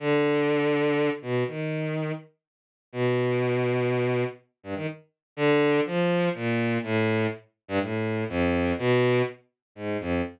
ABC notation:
X:1
M:6/8
L:1/16
Q:3/8=82
K:none
V:1 name="Violin" clef=bass
D,10 B,,2 | ^D,6 z6 | B,,12 | z2 G,, ^D, z4 =D,4 |
F,4 ^A,,4 =A,,4 | z3 G,, A,,4 F,,4 | B,,4 z4 ^G,,2 F,,2 |]